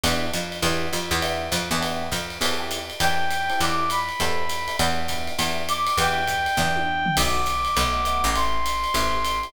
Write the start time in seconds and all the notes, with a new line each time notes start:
0.04 E2 B3 D4 E4 G4, ride
0.33 F2, hi-hat pedal, ride
0.52 ride
0.62 E2 B3 D4 E4 G4, kick, ride
0.93 F2, hi-hat pedal, ride
1.11 E2, ride
1.22 B3 D4 E4 G4, ride
1.52 F2, kick, hi-hat pedal, ride
1.71 E2 B3 D4 E4 G4, ride
1.81 B3 D4 E4 G4, ride
2.12 F2, kick, hi-hat pedal, ride
2.30 ride
2.41 E2 C4 E4 G4 A4, ride
2.60 C4 E4 G4 A4
2.71 hi-hat pedal, ride
2.90 ride
3.00 E2 C4 E4 G4 A4 G5, ride
3.31 hi-hat pedal, ride
3.50 C4 E4 G4 A4, ride
3.60 E2 D6, ride
3.90 B5, hi-hat pedal, ride
4.09 ride
4.20 E2 C4 E4 G4 A4, kick, ride
4.49 hi-hat pedal, ride
4.68 C4 E4 G4 A4, ride
4.79 E2 B3 D4 E4 G4, ride
5.08 B3 D4 E4 G4, kick, hi-hat pedal, ride
5.27 ride
5.39 E2 B3 D4 E4 G4, ride
5.69 D6, hi-hat pedal, ride
5.87 ride
5.98 E2 B3 D4 E4 G4 G5, ride
6.27 kick, hi-hat pedal, ride
6.46 ride
6.57 E2 B3 D4 E4 G4, kick, snare
6.76 high tom
7.06 floor tom
7.17 B1 A3 B3 D#4 F#4 D6, kick, crash, ride
7.46 hi-hat pedal, ride
7.65 ride
7.76 B1 A3 B3 D#4 F#4, kick, ride
8.05 A3 B3 D#4 F#4, hi-hat pedal, ride
8.24 A1, ride
8.35 A3 C4 E4 G4 C6, ride
8.66 hi-hat pedal, ride
8.84 ride
8.94 A1 A3 C4 E4 G4, kick, ride
9.25 hi-hat pedal, ride
9.43 A3 C4 E4 G4, ride